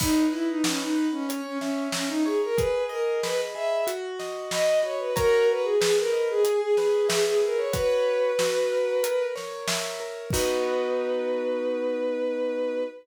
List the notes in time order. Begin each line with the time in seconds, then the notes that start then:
0.00 D#4 B4, kick, crash
0.31 E4 D#5
0.49 D#4
0.64 C#4 F#5, snare
0.80 D#4
0.96 B4
1.12 C#4
1.29 C#5, closed hi-hat
1.46 C#4
1.59 C#4 E5, snare
1.92 C#4 A#5, snare
2.08 D#4
2.25 G#4 C#5
2.44 A#4
2.57 G#4 B4, kick, closed hi-hat
2.89 A#4 D#5
3.23 B4 B5, snare
3.55 G#4 E5
3.87 F#4, closed hi-hat
4.19 D#5, snare
4.51 D#5 B5, snare
4.83 F#4 C#5
4.99 B4
5.16 F#4 A#4 C#5 A#5, kick, closed hi-hat
5.50 B4
5.64 G#4
5.81 G#4 B4, snare
5.98 A#4
6.13 D#5
6.30 G#4
6.44 G#4, closed hi-hat
6.61 G#4
6.76 G#4 B4, snare
7.09 G#4 E5, snare
7.25 G#4
7.42 G#4 A#4
7.57 C#5
7.73 F#4 B4 C#5, kick, closed hi-hat
8.39 F#4, snare
8.72 A#4
9.03 A#4, closed hi-hat
9.35 C#5, snare
9.67 E5, snare
10.00 A#4
10.31 B3 D#4 F#4 B4, kick, crash